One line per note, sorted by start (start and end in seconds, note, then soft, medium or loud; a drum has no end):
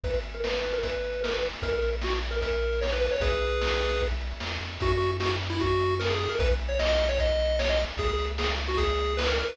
0.04 1.50 G#1 medium
0.04 0.14 B4 medium
0.04 kick loud
0.04 closed hi-hat medium
0.14 closed hi-hat medium
0.23 closed hi-hat medium
0.34 0.44 A#4 medium
0.34 closed hi-hat medium
0.44 0.53 B4 medium
0.44 snare loud
0.52 0.73 B4 medium
0.52 closed hi-hat medium
0.63 closed hi-hat medium
0.73 0.82 A#4 medium
0.73 closed hi-hat medium
0.83 1.21 B4 medium
0.83 kick medium
0.83 closed hi-hat loud
0.93 closed hi-hat medium
1.04 closed hi-hat medium
1.13 closed hi-hat medium
1.23 1.32 A#4 medium
1.23 snare loud
1.33 1.42 B4 medium
1.33 closed hi-hat medium
1.42 closed hi-hat medium
1.53 closed hi-hat medium
1.62 3.09 A#1 medium
1.62 1.72 A#4 medium
1.62 kick loud
1.62 closed hi-hat loud
1.73 1.90 A#4 medium
1.73 closed hi-hat medium
1.82 closed hi-hat medium
1.93 closed hi-hat medium
2.01 2.13 F#4 medium
2.01 snare loud
2.13 closed hi-hat medium
2.23 closed hi-hat medium
2.31 2.40 A#4 medium
2.31 closed hi-hat medium
2.41 2.80 A#4 medium
2.41 kick medium
2.41 closed hi-hat loud
2.52 closed hi-hat medium
2.62 closed hi-hat medium
2.72 closed hi-hat medium
2.81 2.91 C#5 medium
2.81 snare loud
2.91 3.01 B4 medium
2.91 closed hi-hat medium
3.01 3.11 B4 medium
3.01 closed hi-hat medium
3.11 3.21 C#5 medium
3.11 open hi-hat medium
3.20 4.34 B1 loud
3.20 4.02 G#4 medium
3.20 4.02 B4 medium
3.20 kick loud
3.20 closed hi-hat loud
3.31 closed hi-hat medium
3.41 closed hi-hat medium
3.51 closed hi-hat medium
3.62 snare loud
3.72 closed hi-hat medium
3.81 closed hi-hat medium
3.90 closed hi-hat medium
4.01 kick medium
4.01 closed hi-hat medium
4.11 closed hi-hat medium
4.21 closed hi-hat medium
4.31 closed hi-hat medium
4.40 4.59 E2 medium
4.40 snare loud
4.51 closed hi-hat medium
4.61 4.78 F2 medium
4.61 closed hi-hat medium
4.71 closed hi-hat medium
4.80 6.28 F#2 loud
4.80 4.91 F#4 medium
4.80 kick loud
4.80 closed hi-hat loud
4.91 5.11 F#4 medium
4.91 closed hi-hat medium
5.00 closed hi-hat medium
5.10 closed hi-hat medium
5.20 5.30 F#4 medium
5.20 snare loud
5.30 closed hi-hat medium
5.40 closed hi-hat medium
5.50 5.59 E4 medium
5.50 closed hi-hat medium
5.60 5.95 F#4 medium
5.60 kick medium
5.60 closed hi-hat loud
5.71 closed hi-hat medium
5.80 closed hi-hat medium
5.89 closed hi-hat medium
6.00 6.09 A#4 medium
6.00 snare loud
6.09 6.19 G#4 medium
6.09 closed hi-hat medium
6.19 6.30 G#4 medium
6.19 closed hi-hat medium
6.29 6.39 A#4 medium
6.29 closed hi-hat medium
6.39 7.85 B1 loud
6.39 6.49 B4 medium
6.39 kick loud
6.39 closed hi-hat loud
6.49 closed hi-hat medium
6.59 closed hi-hat medium
6.69 6.78 C#5 medium
6.69 closed hi-hat medium
6.79 6.88 D#5 medium
6.79 snare loud
6.88 7.05 D#5 medium
6.88 closed hi-hat medium
6.99 closed hi-hat medium
7.09 7.18 C#5 medium
7.09 closed hi-hat medium
7.19 7.57 D#5 medium
7.19 kick medium
7.19 closed hi-hat loud
7.29 closed hi-hat medium
7.39 closed hi-hat medium
7.49 closed hi-hat medium
7.59 7.69 C#5 medium
7.59 snare loud
7.69 7.79 D#5 medium
7.69 closed hi-hat medium
7.79 closed hi-hat medium
7.89 closed hi-hat medium
7.97 9.43 C#2 medium
7.97 8.08 G#4 medium
7.97 kick loud
7.97 closed hi-hat loud
8.08 8.26 G#4 medium
8.08 closed hi-hat medium
8.18 closed hi-hat medium
8.28 closed hi-hat medium
8.38 8.48 G#4 medium
8.38 snare loud
8.49 closed hi-hat medium
8.58 closed hi-hat medium
8.68 8.78 F#4 medium
8.68 closed hi-hat medium
8.77 9.14 G#4 medium
8.77 kick medium
8.77 closed hi-hat loud
8.89 closed hi-hat medium
8.98 closed hi-hat medium
9.09 closed hi-hat medium
9.17 9.27 B4 medium
9.17 snare loud
9.28 9.37 A#4 medium
9.28 closed hi-hat medium
9.38 9.49 A#4 medium
9.38 closed hi-hat medium
9.48 9.57 B4 medium
9.48 closed hi-hat medium